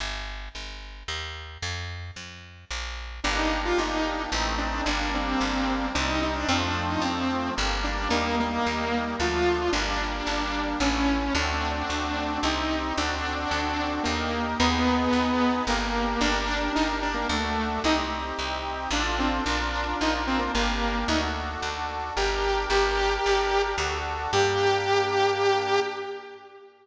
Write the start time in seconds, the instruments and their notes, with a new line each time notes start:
0.00 electric bass (finger) G1
0.55 electric bass (finger) G1
1.08 electric bass (finger) D#2
1.62 electric bass (finger) F2
2.16 electric bass (finger) F2
2.70 electric bass (finger) A#1
3.24 electric bass (finger) G1, accordion A#3 D4 G4, lead 2 (sawtooth) D4
3.36 lead 2 (sawtooth) D#4
3.65 lead 2 (sawtooth) F4
3.78 electric bass (finger) G1, lead 2 (sawtooth) D#4
4.32 electric bass (finger) A1, accordion A3 C4 D#4
4.58 lead 2 (sawtooth) D4
4.86 electric bass (finger) G1, accordion G3 A#3 D4, lead 2 (sawtooth) D4
5.14 lead 2 (sawtooth) C4
5.41 electric bass (finger) G1
5.95 electric bass (finger) C2, accordion G3 C4 D#4, lead 2 (sawtooth) D4
6.08 lead 2 (sawtooth) D#4
6.22 lead 2 (sawtooth) D#4
6.35 lead 2 (sawtooth) D4
6.48 electric bass (finger) F2, accordion F3 A3 C4, lead 2 (sawtooth) C4
6.63 lead 2 (sawtooth) D4
6.90 lead 2 (sawtooth) D#4
7.01 electric bass (finger) F2, lead 2 (sawtooth) C4
7.56 electric bass (finger) G1, accordion G3 A#3 D4
7.84 lead 2 (sawtooth) D4
8.10 electric bass (finger) D#2, accordion G3 A#3 D#4, lead 2 (sawtooth) A#3
8.40 lead 2 (sawtooth) A#3
8.66 electric bass (finger) D#2
9.19 electric bass (finger) D2, accordion F3 A3 D4, lead 2 (sawtooth) F4
9.72 electric bass (finger) G1, accordion G3 A#3 D4, lead 2 (sawtooth) D4
10.27 electric bass (finger) G1
10.80 electric bass (finger) A1, accordion A3 C#4 E4, lead 2 (sawtooth) C#4
11.35 electric bass (finger) D2, accordion A3 C4 D4 F#4, lead 2 (sawtooth) D4
11.90 electric bass (finger) D2
12.43 electric bass (finger) C2, accordion C4 D#4 G4, lead 2 (sawtooth) D#4
12.97 electric bass (finger) D2, accordion C4 D4 F#4 A4, lead 2 (sawtooth) D4
13.51 electric bass (finger) D2
14.03 electric bass (finger) D#2, lead 2 (sawtooth) A#3, accordion D#4 G4 A#4
14.59 electric bass (finger) D#2, lead 2 (sawtooth) B3, accordion D#4 G#4 B4
15.13 electric bass (finger) D#2
15.67 electric bass (finger) G1, lead 2 (sawtooth) A#3, accordion D4 G4 A#4
16.21 electric bass (finger) G1, lead 2 (sawtooth) D4, accordion D4 G4 A#4
16.75 electric bass (finger) G1, lead 2 (sawtooth) D#4
17.02 lead 2 (sawtooth) D4
17.14 lead 2 (sawtooth) A#3
17.29 electric bass (finger) D2, lead 2 (sawtooth) A3, accordion D4 F#4 A4
17.84 electric bass (finger) C2, accordion C4 D#4 G4, lead 2 (sawtooth) D#4
18.39 electric bass (finger) C2
18.91 electric bass (finger) A1, accordion D4 F4 A4, lead 2 (sawtooth) D4
19.18 lead 2 (sawtooth) C4
19.46 electric bass (finger) A#1, accordion D4 F4 A#4, lead 2 (sawtooth) D4
20.01 electric bass (finger) A#1, lead 2 (sawtooth) D#4
20.27 lead 2 (sawtooth) C4
20.39 lead 2 (sawtooth) A#3
20.54 electric bass (finger) G1, lead 2 (sawtooth) A#3, accordion D4 G4 A#4
21.08 electric bass (finger) D2, accordion D4 F#4 A4, lead 2 (sawtooth) D#4
21.62 electric bass (finger) D2
22.16 electric bass (finger) G1, accordion D4 G4 A#4, lead 2 (sawtooth) G4
22.70 electric bass (finger) G1, accordion D4 G4 A#4, lead 2 (sawtooth) G4
23.26 electric bass (finger) G1
23.78 electric bass (finger) D2, accordion D4 F#4 A4
24.32 electric bass (finger) G2, accordion A#3 D4 G4, lead 2 (sawtooth) G4